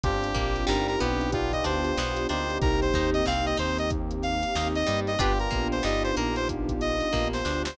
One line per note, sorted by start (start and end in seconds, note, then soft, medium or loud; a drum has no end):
0.03 0.32 G1 loud
0.03 1.32 C4 medium
0.03 1.31 C4 medium
0.03 1.32 D4 loud
0.03 1.31 D4 loud
0.03 1.32 F4 loud
0.03 1.31 F4 medium
0.03 1.32 G4 medium
0.03 1.31 G4 loud
0.03 0.65 G4 medium
0.03 kick loud
0.03 closed hi-hat loud
0.24 closed hi-hat medium
0.35 0.65 A#1 loud
0.35 0.63 A#3 medium
0.35 kick medium
0.35 closed hi-hat medium
0.56 closed hi-hat medium
0.67 0.97 G1 loud
0.67 0.95 G3 loud
0.67 1.78 D#4 medium
0.67 1.78 G4 loud
0.67 0.87 A#4 medium
0.67 snare loud
0.88 0.99 A#4 medium
0.88 closed hi-hat medium
1.00 1.62 B1 loud
1.00 1.61 B3 loud
1.00 1.31 G4 medium
1.00 closed hi-hat medium
1.21 closed hi-hat medium
1.32 2.61 B3 medium
1.32 2.26 B3 medium
1.32 2.61 D4 loud
1.32 2.26 D4 medium
1.32 2.61 F4 medium
1.32 1.52 F4 medium
1.32 2.26 F4 loud
1.32 2.61 G4 loud
1.32 2.26 G4 loud
1.32 kick medium
1.32 closed hi-hat loud
1.52 1.64 D#5 medium
1.52 kick medium
1.52 closed hi-hat medium
1.64 1.93 D2 medium
1.64 1.93 D4 medium
1.64 2.27 C5 medium
1.64 closed hi-hat medium
1.85 closed hi-hat medium
1.97 2.26 B1 medium
1.97 2.27 B3 medium
1.97 snare loud
2.17 snare soft
2.17 closed hi-hat medium
2.29 2.58 D2 medium
2.29 5.16 A#3 medium
2.29 5.16 C4 medium
2.29 2.58 D4 medium
2.29 5.16 D#4 medium
2.29 5.16 G4 loud
2.29 2.58 C5 medium
2.29 closed hi-hat medium
2.50 closed hi-hat medium
2.61 2.90 C2 loud
2.61 5.18 A#3 loud
2.61 5.18 C4 loud
2.61 3.21 D#4 loud
2.61 5.18 D#4 medium
2.61 3.21 G4 loud
2.61 5.18 G4 medium
2.61 2.80 A#4 loud
2.61 kick loud
2.61 closed hi-hat medium
2.81 3.10 C5 medium
2.81 snare soft
2.81 closed hi-hat medium
2.94 3.22 D#2 medium
2.94 3.23 D#4 medium
2.94 kick medium
2.94 closed hi-hat medium
3.14 3.25 D#5 medium
3.14 closed hi-hat medium
3.26 3.55 C2 medium
3.26 3.56 C4 medium
3.26 3.46 F5 medium
3.26 snare medium
3.46 3.58 D#5 medium
3.46 closed hi-hat medium
3.57 4.44 D#2 medium
3.57 4.43 D#4 medium
3.57 3.78 C5 medium
3.57 closed hi-hat medium
3.78 3.90 D#5 medium
3.78 closed hi-hat medium
3.90 kick loud
3.90 closed hi-hat loud
4.11 closed hi-hat medium
4.23 4.68 F5 medium
4.23 snare soft
4.23 closed hi-hat medium
4.43 closed hi-hat medium
4.55 4.84 D#2 medium
4.55 5.11 D#4 loud
4.55 4.85 D#4 medium
4.55 5.11 G4 loud
4.55 snare loud
4.75 5.00 D#5 medium
4.75 closed hi-hat medium
4.86 5.17 G2 medium
4.86 5.15 G3 medium
4.86 closed hi-hat loud
5.07 5.19 D#5 medium
5.07 snare soft
5.07 closed hi-hat medium
5.19 5.48 G1 loud
5.19 7.74 B3 medium
5.19 7.76 B3 loud
5.19 5.33 D4 medium
5.19 7.74 D4 medium
5.19 7.76 D4 loud
5.19 5.33 F4 medium
5.19 7.74 F4 loud
5.19 7.76 F4 loud
5.19 5.39 G4 medium
5.19 7.74 G4 medium
5.19 7.76 G4 medium
5.19 5.33 G4 medium
5.19 5.33 B4 medium
5.19 kick loud
5.19 closed hi-hat loud
5.39 5.68 A#4 medium
5.39 closed hi-hat medium
5.51 5.81 A#1 medium
5.51 5.79 A#3 medium
5.51 kick medium
5.51 snare soft
5.51 closed hi-hat medium
5.72 5.83 C5 medium
5.72 closed hi-hat medium
5.83 6.13 G1 loud
5.83 6.11 G3 medium
5.83 7.08 D#4 medium
5.83 7.08 G4 loud
5.83 6.03 D#5 medium
5.83 snare medium
6.04 6.16 C5 medium
6.04 closed hi-hat medium
6.17 7.02 A#1 medium
6.17 7.03 A#3 medium
6.17 6.35 A#4 medium
6.17 closed hi-hat medium
6.36 6.48 C5 medium
6.36 closed hi-hat medium
6.49 kick medium
6.49 closed hi-hat loud
6.69 kick medium
6.69 closed hi-hat medium
6.81 7.28 D#5 medium
6.81 closed hi-hat medium
7.00 closed hi-hat medium
7.13 7.42 A#1 medium
7.13 7.41 A#3 medium
7.13 kick medium
7.13 snare medium
7.33 7.62 C5 medium
7.33 snare medium
7.45 7.74 D2 medium
7.45 7.74 D4 medium
7.45 snare medium
7.65 7.77 C5 medium
7.65 snare loud